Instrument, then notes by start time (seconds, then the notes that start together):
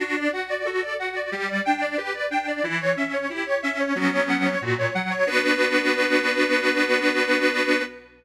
accordion
0.00 D4 F#4
0.16 D5
0.32 F#4 F#5
0.50 D5
0.65 F#4 A4
0.82 D5
0.99 F#4 F#5
1.15 D5
1.32 G3 G4
1.48 D5
1.65 D4 G5
1.81 D5
1.97 G4 B4
2.14 D5
2.30 D4 G5
2.48 D5
2.63 E3 E4
2.80 C#5
2.96 C#4 E5
3.13 C#5
3.30 E4 G4
3.46 C#5
3.63 C#4 E5
3.79 C#5
3.95 F#3 B3 C#4 F#4
4.12 C#5
4.29 F#5
4.45 C#5
4.62 A#2 F#4
4.78 C#5
4.94 F#3 F#5
5.11 C#5
5.27 B3 D4 F#4 B4